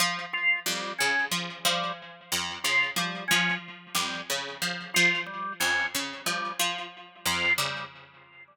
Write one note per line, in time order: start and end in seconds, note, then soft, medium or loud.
0.00 0.25 F3 medium
0.33 0.59 F4 medium
0.66 0.92 F2 medium
0.66 0.92 G3 medium
0.98 1.27 C#3 medium
0.98 1.25 C#4 medium
1.31 1.58 F3 medium
1.65 1.91 F3 medium
1.65 1.92 G3 medium
2.32 2.58 F2 medium
2.64 2.91 C#3 medium
2.64 2.90 F4 medium
2.96 3.23 F3 medium
2.96 3.24 G3 medium
3.28 3.57 F3 medium
3.28 3.54 C#4 medium
3.95 4.21 F2 medium
3.95 4.21 G3 medium
4.30 4.56 C#3 medium
4.62 4.88 F3 medium
4.94 5.23 F3 medium
4.94 5.20 F4 medium
5.26 5.53 G3 medium
5.60 5.87 F2 medium
5.60 5.86 C#4 medium
5.95 6.21 C#3 medium
6.26 6.53 F3 medium
6.26 6.52 G3 medium
6.59 6.86 F3 medium
7.26 7.52 F2 medium
7.26 7.53 F4 medium
7.58 7.84 C#3 medium
7.58 7.84 G3 medium